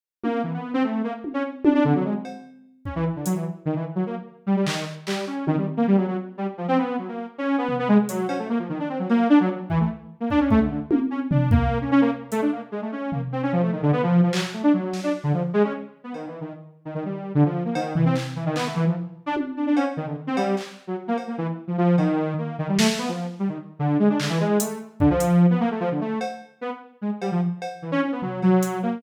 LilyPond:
<<
  \new Staff \with { instrumentName = "Lead 2 (sawtooth)" } { \time 4/4 \tempo 4 = 149 r8 ais8 e16 b8 c'16 a8 ais16 r8 cis'16 r8 | d'16 d'16 d16 fis16 gis16 r4. r16 cis'16 e16 r16 d16 | fis16 e16 r8 dis16 e16 r16 fis16 ais16 r8. g16 g16 dis8 | r8 g8 cis'8 dis16 g16 r16 ais16 g16 fis16 fis16 r8 g16 |
r16 f16 c'16 b8 fis16 ais8 r16 cis'8 b8 b16 gis16 r16 | fis8 cis'16 a16 ais16 f16 dis16 d'16 c'16 fis16 ais8 d'16 fis16 r8 | e16 a16 r8. ais16 d'16 cis'16 a16 d16 d16 r16 ais16 r16 cis'16 r16 | d'8 ais8. cis'16 cis'16 ais16 r8 a16 d'16 ais16 r16 gis16 a16 |
cis'8 ais16 r16 c'16 cis'16 f16 a16 dis16 d16 b16 f8 f16 fis16 r16 | a16 d'16 fis8. d'16 r16 d16 f16 r16 gis16 cis'16 r8. b16 | \tuplet 3/2 { dis8 e8 dis8 } r8. dis16 dis16 g8. d16 f8 ais16 | dis8 e16 c'16 r8 e16 dis16 b16 a16 e16 f16 r8. d'16 |
r8 d'16 d'16 cis'16 r16 dis16 d16 r16 c'16 g8 r8. fis16 | r16 ais16 r16 ais16 e16 r8 f16 f8 dis4 ais8 | dis16 g16 a16 a16 b16 f8 r16 g16 dis16 r8 d8 gis16 d'16 | d16 e16 gis8 a8 r8 d16 f4 b16 ais16 a16 |
f16 d16 a8 r4 b16 r8. gis16 r16 g16 f16 | r4 e16 cis'16 cis'16 b16 fis8 fis4 ais8 | }
  \new DrumStaff \with { instrumentName = "Drums" } \drummode { \time 4/4 r8 tommh8 r4 r4 tommh4 | tommh4 r8 cb8 r4 bd4 | hh4 r4 r4 r8 hc8 | r8 hc8 r8 tommh8 r4 r4 |
r4 r4 r4 tomfh4 | hh8 cb8 r4 r8 cb8 r4 | bd4 r8 bd8 bd4 tommh4 | tomfh8 bd8 r4 r8 hh8 r4 |
r8 tomfh8 r4 r8 tomfh8 r8 hc8 | r4 sn4 r4 r4 | cb4 r4 r4 r4 | cb8 tomfh8 hc4 hc4 r4 |
tommh4 cb4 r8 cb8 hc4 | r8 cb8 r4 r8 cb8 r4 | r8 sn8 r4 r4 r4 | hc4 hh4 bd8 hh8 r4 |
r4 cb4 r4 r8 cb8 | r8 cb8 r4 tomfh8 cb8 hh4 | }
>>